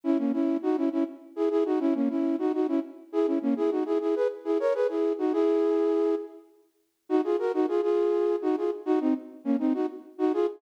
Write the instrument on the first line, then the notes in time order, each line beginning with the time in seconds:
flute
0.04 C#4 E4
0.18 A#3 C#4
0.33 C#4 E4
0.62 D#4 F#4
0.77 C#4 E4
0.92 C#4 E4
1.36 E4 G#4
1.51 E4 G#4
1.65 D#4 F#4
1.80 C#4 E4
1.94 A#3 C#4
2.09 C#4 E4
2.39 D#4 F#4
2.54 D#4 F#4
2.68 C#4 E4
3.12 E4 G#4
3.27 C#4 E4
3.42 A#3 C#4
3.57 E4 G#4
3.71 D#4 F#4
3.86 E4 G#4
4.01 E4 G#4
4.16 G#4 B4
4.45 E4 G#4
4.60 A#4 C#5
4.74 G#4 B4
4.89 E4 G#4
5.18 D#4 F#4
5.33 E4 G#4
7.09 D#4 F#4
7.24 F4 G#4
7.39 F#4 A#4
7.54 D#4 F#4
7.68 F4 G#4
7.82 F4 G#4
8.42 D#4 F#4
8.57 F4 G#4
8.86 D#4 F#4
9.01 C4 D#4
9.44 A#3 C#4
9.59 C4 D#4
9.74 D#4 F#4
10.18 D#4 F#4
10.33 F4 G#4